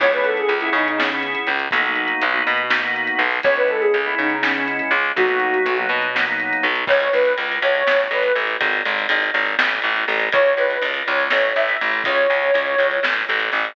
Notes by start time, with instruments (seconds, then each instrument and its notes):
0.00 electric bass (finger) C#2, drawbar organ B3 C#4 E4 G#4, ocarina C#5, kick, crash
0.12 drawbar organ B3 C#4 E4 G#4, ocarina B4, closed hi-hat
0.24 ocarina A4, closed hi-hat
0.37 ocarina G#4, closed hi-hat
0.49 electric bass (finger) C#2, closed hi-hat
0.61 drawbar organ B3 C#4 E4 G#4, ocarina E4, closed hi-hat
0.73 electric bass (finger) C#3, ocarina D#4, closed hi-hat
0.86 ocarina D#4, closed hi-hat
0.98 drawbar organ B3 C#4 E4 G#4, ocarina C#4, snare
1.10 drawbar organ B3 C#4 E4 G#4, closed hi-hat
1.23 closed hi-hat
1.35 closed hi-hat
1.47 electric bass (finger) C#2, closed hi-hat
1.59 closed hi-hat
1.71 electric bass (finger) B1, drawbar organ A#3 B3 D#4 F#4, kick, closed hi-hat
1.85 drawbar organ A#3 B3 D#4 F#4, closed hi-hat
1.95 closed hi-hat
2.08 closed hi-hat
2.22 electric bass (finger) B1, closed hi-hat
2.33 drawbar organ A#3 B3 D#4 F#4, closed hi-hat
2.47 electric bass (finger) B2, closed hi-hat
2.57 closed hi-hat
2.70 drawbar organ A#3 B3 D#4 F#4, snare
2.83 drawbar organ A#3 B3 D#4 F#4, closed hi-hat
2.96 closed hi-hat
3.07 closed hi-hat
3.19 electric bass (finger) B1, closed hi-hat
3.30 open hi-hat
3.43 electric bass (finger) C#2, drawbar organ G#3 B3 C#4 E4, ocarina C#5, kick, closed hi-hat
3.57 drawbar organ G#3 B3 C#4 E4, ocarina B4, closed hi-hat
3.68 ocarina A4, closed hi-hat
3.81 ocarina G#4, closed hi-hat
3.94 electric bass (finger) C#2, closed hi-hat
4.05 drawbar organ G#3 B3 C#4 E4, ocarina E4, closed hi-hat
4.18 electric bass (finger) C#3, ocarina D#4, closed hi-hat
4.30 ocarina D#4, closed hi-hat
4.42 drawbar organ G#3 B3 C#4 E4, ocarina C#4, snare
4.54 drawbar organ G#3 B3 C#4 E4, closed hi-hat
4.68 closed hi-hat
4.79 closed hi-hat
4.91 electric bass (finger) C#2, closed hi-hat
5.05 closed hi-hat
5.16 electric bass (finger) B1, drawbar organ F#3 A#3 B3 D#4, ocarina F#4, kick, closed hi-hat
5.28 drawbar organ F#3 A#3 B3 D#4, closed hi-hat
5.40 closed hi-hat
5.54 closed hi-hat
5.66 electric bass (finger) B1, closed hi-hat
5.77 drawbar organ F#3 A#3 B3 D#4, closed hi-hat
5.89 electric bass (finger) B2, closed hi-hat
6.02 closed hi-hat
6.15 drawbar organ F#3 A#3 B3 D#4, snare
6.26 drawbar organ F#3 A#3 B3 D#4, closed hi-hat
6.40 closed hi-hat
6.53 closed hi-hat
6.63 electric bass (finger) B1, closed hi-hat
6.76 closed hi-hat
6.87 electric bass (finger) C#2, ocarina C#5, kick, crash
7.00 ride
7.13 electric bass (finger) C#2, ocarina B4, ride
7.25 ride
7.38 electric bass (finger) C#2, ride
7.52 ride
7.62 electric bass (finger) C#2, ocarina C#5, ride
7.75 ride
7.87 electric bass (finger) A1, snare
8.00 ride
8.11 electric bass (finger) A1, ocarina B4, ride
8.23 ride
8.35 electric bass (finger) A1, ride
8.47 ride
8.61 electric bass (finger) G#1, kick, ride
8.73 ride
8.85 electric bass (finger) G#1, ride
8.99 ride
9.09 electric bass (finger) G#1, ride
9.23 ride
9.34 electric bass (finger) G#1, ride
9.46 ride
9.59 electric bass (finger) A1, snare
9.70 ride
9.82 electric bass (finger) A1, ride
9.97 ride
10.08 electric bass (finger) A1, ride
10.20 ride
10.32 electric bass (finger) C#2, ocarina C#5, kick, ride
10.46 ride
10.57 electric bass (finger) C#2, ocarina B4, ride
10.70 ride
10.82 electric bass (finger) C#2, ride
10.94 ride
11.06 electric bass (finger) C#2, ocarina C#5, ride
11.20 ride
11.30 electric bass (finger) A1, snare
11.45 ride
11.56 electric bass (finger) A1, ocarina E5, ride
11.69 ride
11.81 electric bass (finger) A1, ride
11.91 ride
12.04 electric bass (finger) C#2, ocarina C#5, kick, ride
12.15 ride
12.30 electric bass (finger) C#2, ride
12.43 ride
12.54 electric bass (finger) C#2, ride
12.67 ride
12.78 electric bass (finger) C#2, ride
12.91 ride
13.03 electric bass (finger) A1, snare
13.16 ride
13.29 electric bass (finger) A1, ride
13.40 ride
13.52 electric bass (finger) A1, ride
13.65 ride